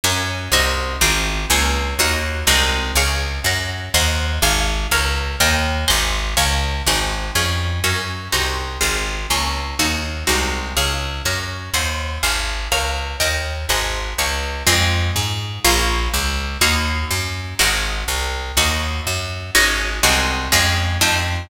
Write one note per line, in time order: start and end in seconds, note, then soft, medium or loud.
0.04 0.49 F#2 medium
0.04 0.52 C#4 medium
0.04 0.52 F#4 medium
0.04 0.52 A#4 medium
0.52 0.96 C2 medium
0.52 1.01 C4 medium
0.52 1.01 D#4 medium
0.52 1.01 F#4 medium
1.01 1.46 G#1 medium
1.01 1.49 C4 medium
1.01 1.49 F4 medium
1.01 1.49 G#4 medium
1.50 1.95 C#2 medium
1.50 1.98 A#3 medium
1.50 1.98 C#4 medium
1.50 1.98 F4 medium
1.99 2.44 D#2 medium
1.99 2.48 A#3 medium
1.99 2.47 D#4 medium
1.99 2.47 F#4 medium
2.47 2.92 C2 medium
2.47 2.95 G#3 medium
2.47 2.95 C4 medium
2.47 2.95 D#4 medium
2.47 2.95 F#4 medium
2.95 3.40 C#2 medium
2.95 3.45 G#4 medium
2.95 3.45 C#5 medium
2.95 3.45 F5 medium
3.44 3.89 F#2 medium
3.44 3.94 A#4 medium
3.44 3.94 C#5 medium
3.44 3.94 F#5 medium
3.94 4.39 D#2 loud
3.94 4.42 C5 medium
3.94 4.42 D#5 medium
3.94 4.42 F#5 medium
4.42 4.87 G#1 medium
4.42 4.91 C5 medium
4.42 4.91 F5 medium
4.42 4.91 G#5 medium
4.91 5.36 C#2 medium
4.91 5.40 A#4 medium
4.91 5.40 C#5 medium
4.91 5.40 F5 medium
5.40 5.85 D#2 medium
5.40 5.89 A#4 medium
5.40 5.87 D#5 medium
5.40 5.89 G5 medium
5.88 6.35 G#1 medium
5.88 6.36 C5 medium
5.88 6.36 D#5 medium
5.88 6.36 F#5 medium
5.88 6.36 G#5 medium
6.37 6.82 C#2 medium
6.37 6.85 C#5 medium
6.37 6.85 F5 medium
6.37 6.85 G#5 medium
6.86 7.31 G#1 medium
6.86 7.35 C4 medium
6.86 7.35 D#4 medium
6.86 7.35 F#4 medium
6.86 7.35 G#4 medium
7.35 7.80 F2 medium
7.35 7.83 C#4 medium
7.35 7.83 F4 medium
7.35 7.83 G#4 medium
7.84 8.29 F#2 medium
7.84 8.32 C#4 medium
7.84 8.32 F#4 medium
7.84 8.32 A#4 medium
8.32 8.78 C2 medium
8.32 8.80 C4 medium
8.32 8.80 D#4 medium
8.32 8.80 F#4 medium
8.81 9.27 G#1 medium
8.81 9.29 C4 medium
8.81 9.29 F4 medium
8.81 9.29 G#4 medium
9.30 9.75 C#2 medium
9.30 9.78 A#3 medium
9.30 9.78 C#4 medium
9.30 9.78 F4 medium
9.79 10.24 D#2 medium
9.79 10.27 A#3 medium
9.79 10.27 D#4 medium
9.79 10.27 F#4 medium
10.27 10.73 C2 medium
10.27 10.75 G#3 medium
10.27 10.75 C4 medium
10.27 10.75 D#4 medium
10.27 10.75 F#4 medium
10.77 11.22 C#2 medium
10.77 11.24 G#4 medium
10.77 11.24 C#5 medium
10.77 11.24 F5 medium
11.25 11.70 F#2 medium
11.25 11.74 A#4 medium
11.25 11.74 C#5 medium
11.25 11.74 F#5 medium
11.74 12.18 D#2 medium
11.74 12.22 C5 medium
11.74 12.22 D#5 medium
11.74 12.22 F#5 medium
12.23 12.68 G#1 medium
12.23 12.71 C5 medium
12.23 12.71 F5 medium
12.23 12.71 G#5 medium
12.72 13.17 C#2 medium
12.72 13.19 A#4 medium
12.72 13.20 C#5 medium
12.72 13.20 F5 medium
13.20 13.66 D#2 medium
13.20 13.68 A#4 medium
13.20 13.68 D#5 medium
13.20 13.68 G5 medium
13.69 14.14 G#1 medium
13.69 14.18 C5 medium
13.69 14.18 D#5 medium
13.69 14.18 F#5 medium
13.69 14.18 G#5 medium
14.18 14.63 C#2 medium
14.18 14.67 C#5 medium
14.18 14.67 F5 medium
14.18 14.67 G#5 medium
14.67 15.11 F2 loud
14.67 15.62 G#3 medium
14.67 15.62 C4 medium
14.67 15.62 F4 medium
15.16 15.60 G#2 medium
15.64 16.09 A#1 loud
15.64 16.60 A#3 medium
15.64 16.60 C#4 medium
15.64 16.60 F4 medium
16.14 16.57 C#2 medium
16.61 17.05 D#2 medium
16.61 17.57 A#3 medium
16.61 17.57 D#4 medium
16.61 17.57 F#4 medium
17.11 17.54 F#2 medium
17.59 18.04 G#1 medium
17.59 18.55 G#3 medium
17.59 18.55 C4 medium
17.59 18.55 D#4 medium
17.59 18.55 F#4 medium
18.08 18.52 C2 medium
18.57 19.01 D#2 medium
18.57 19.53 A#3 medium
18.57 19.53 D#4 medium
18.57 19.53 F#4 medium
19.07 19.51 F#2 medium
19.55 20.00 G#1 medium
19.55 20.03 G#3 medium
19.55 20.03 C#4 medium
19.55 20.03 D#4 medium
19.55 20.03 F#4 medium
20.03 20.49 C2 medium
20.03 20.51 G#3 medium
20.03 20.51 C4 medium
20.03 20.51 D#4 medium
20.03 20.51 F#4 medium
20.52 20.98 F2 loud
20.52 21.00 G#3 medium
20.52 21.00 C#4 medium
20.52 21.00 F4 medium
21.01 21.47 F2 medium
21.01 21.49 A3 medium
21.01 21.49 C4 medium
21.01 21.49 D#4 medium
21.01 21.49 F4 medium